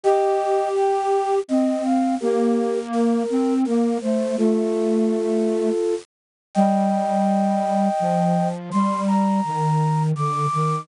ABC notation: X:1
M:3/4
L:1/8
Q:1/4=83
K:Gm
V:1 name="Flute"
[eg]2 g2 e f | [GB]2 B2 B c | [FA]5 z | [eg]6 |
c' b3 d'2 |]
V:2 name="Flute"
G4 C2 | B,3 C B, A, | A,4 z2 | G,4 F,2 |
G,2 E,2 D, E, |]